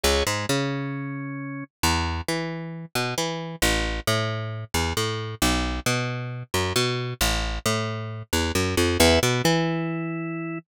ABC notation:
X:1
M:4/4
L:1/8
Q:1/4=134
K:E
V:1 name="Electric Bass (finger)" clef=bass
C,, G,, C,6 | E,,2 E,3 B,, E,2 | A,,,2 A,,3 E,, A,,2 | B,,,2 B,,3 F,, B,,2 |
A,,,2 A,,3 E,, F,, =F,, | E,, B,, E,6 |]
V:2 name="Drawbar Organ"
[Gc] G, C6 | z8 | z8 | z8 |
z8 | [Be] B, E6 |]